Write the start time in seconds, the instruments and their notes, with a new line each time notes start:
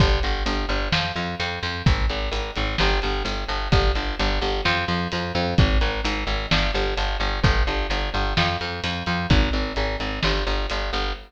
0.00 electric bass (finger) G1, kick, closed hi-hat
0.23 electric bass (finger) G1, closed hi-hat
0.46 electric bass (finger) G1, closed hi-hat
0.69 electric bass (finger) G1, closed hi-hat
0.92 electric bass (finger) F2, snare
1.16 electric bass (finger) F2, closed hi-hat
1.40 electric bass (finger) F2, closed hi-hat
1.63 electric bass (finger) F2, closed hi-hat
1.86 electric bass (finger) G#1, kick, closed hi-hat
2.09 electric bass (finger) G#1, closed hi-hat
2.31 electric bass (finger) G#1, closed hi-hat
2.56 electric bass (finger) G#1, closed hi-hat
2.78 electric bass (finger) G1, snare
3.02 electric bass (finger) G1, closed hi-hat
3.25 electric bass (finger) G1, closed hi-hat
3.48 electric bass (finger) G1, closed hi-hat
3.72 electric bass (finger) G1, kick, closed hi-hat
3.95 electric bass (finger) G1, closed hi-hat
4.19 electric bass (finger) G1, closed hi-hat
4.41 electric bass (finger) G1, closed hi-hat
4.65 electric bass (finger) F2, snare
4.88 electric bass (finger) F2, closed hi-hat
5.12 electric bass (finger) F2, closed hi-hat
5.35 electric bass (finger) F2, closed hi-hat
5.58 electric bass (finger) G#1, kick, closed hi-hat
5.81 electric bass (finger) G#1, closed hi-hat
6.04 electric bass (finger) G#1, closed hi-hat
6.27 electric bass (finger) G#1, closed hi-hat
6.51 electric bass (finger) G1, snare
6.74 electric bass (finger) G1, closed hi-hat
6.97 electric bass (finger) G1, closed hi-hat
7.20 electric bass (finger) G1, closed hi-hat
7.44 electric bass (finger) G1, kick, closed hi-hat
7.67 electric bass (finger) G1, closed hi-hat
7.90 electric bass (finger) G1, closed hi-hat
8.14 electric bass (finger) G1, closed hi-hat
8.37 electric bass (finger) F2, snare
8.61 electric bass (finger) F2, closed hi-hat
8.84 electric bass (finger) F2, closed hi-hat
9.06 electric bass (finger) F2, closed hi-hat
9.30 electric bass (finger) G#1, kick, closed hi-hat
9.53 electric bass (finger) G#1, closed hi-hat
9.76 electric bass (finger) G#1, closed hi-hat
10.00 electric bass (finger) G#1, closed hi-hat
10.23 electric bass (finger) G1, snare
10.47 electric bass (finger) G1, closed hi-hat
10.70 electric bass (finger) G1, closed hi-hat
10.93 electric bass (finger) G1, closed hi-hat